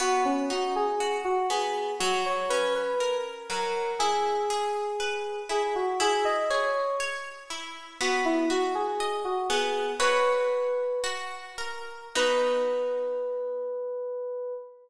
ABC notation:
X:1
M:2/4
L:1/16
Q:1/4=60
K:B
V:1 name="Electric Piano 2"
F C F G2 F G2 | F c B B2 z A2 | G6 G F | G d c2 z4 |
F E F G2 F G2 | "^rit." B4 z4 | B8 |]
V:2 name="Acoustic Guitar (steel)"
B,2 D2 F2 B,2 | F,2 C2 A2 F,2 | E2 G2 B2 E2 | E2 G2 c2 E2 |
B,2 F2 d2 B,2 | "^rit." [FBc]4 F2 A2 | [B,DF]8 |]